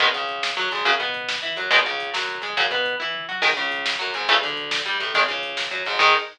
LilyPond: <<
  \new Staff \with { instrumentName = "Overdriven Guitar" } { \time 6/8 \key gis \phrygian \tempo 4. = 140 <dis gis b>8 cis4. fis8 gis,8 | <cis fis>8 b4. e'8 fis8 | <b, dis gis>8 cis4 fis4 gis8 | <cis fis>8 b4 e'4 fis'8 |
<dis gis>8 cis4. fis8 gis,8 | <cis e a>8 d4. g8 a,8 | <dis gis>8 cis4. fis8 gis,8 | <dis gis>4. r4. | }
  \new Staff \with { instrumentName = "Electric Bass (finger)" } { \clef bass \time 6/8 \key gis \phrygian gis,,8 cis,4. fis,8 gis,,8 | fis,8 b,4. e8 fis,8 | gis,,8 cis,4 fis,4 gis,8 | fis,8 b,4 e4 fis8 |
gis,,8 cis,4. fis,8 gis,,8 | a,,8 d,4. g,8 a,,8 | gis,,8 cis,4. fis,8 gis,,8 | gis,4. r4. | }
  \new DrumStaff \with { instrumentName = "Drums" } \drummode { \time 6/8 <hh bd>16 bd16 <hh bd>16 bd16 <hh bd>16 bd16 <bd sn>16 bd16 <hh bd>16 bd16 <hh bd>16 bd16 | <hh bd>16 bd16 <hh bd>16 bd16 <hh bd>16 bd16 <bd sn>16 bd16 <hh bd>16 bd16 <hh bd>16 bd16 | <hh bd>16 bd16 <hh bd>16 bd16 <hh bd>16 bd16 <bd sn>16 bd16 <hh bd>16 bd16 <hh bd>16 bd16 | <hh bd>16 bd16 <hh bd>16 bd16 <hh bd>16 bd16 <bd tomfh>8 toml4 |
<cymc bd>16 bd16 <hh bd>16 bd16 <hh bd>16 bd16 <bd sn>16 bd16 <hh bd>16 bd16 <hh bd>16 bd16 | <hh bd>16 bd16 <hh bd>16 bd16 <hh bd>16 bd16 <bd sn>16 bd16 <hh bd>16 bd16 <hh bd>16 bd16 | <hh bd>16 bd16 <hh bd>16 bd16 <hh bd>16 bd16 <bd sn>16 bd16 <hh bd>16 bd16 <hh bd>16 bd16 | <cymc bd>4. r4. | }
>>